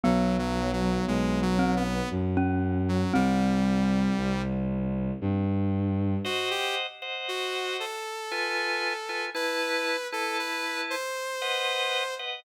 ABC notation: X:1
M:3/4
L:1/16
Q:1/4=58
K:Ab
V:1 name="Glockenspiel"
_C6 =C z2 D3 | C10 z2 | [K:G] z12 | z12 |]
V:2 name="Lead 2 (sawtooth)"
(3_G,2 G,2 G,2 (3A,2 G,2 _C2 z3 G, | G,6 z6 | [K:G] _G =G z2 _G2 A6 | B3 A B2 c6 |]
V:3 name="Drawbar Organ"
z12 | z12 | [K:G] [c_e_g]3 [ceg]5 [=F_c_a]3 [Fca] | [EBa]3 [EBa]5 [B^df]3 [Bdf] |]
V:4 name="Violin" clef=bass
_C,,4 C,,4 _G,,4 | C,,4 C,,4 G,,4 | [K:G] z12 | z12 |]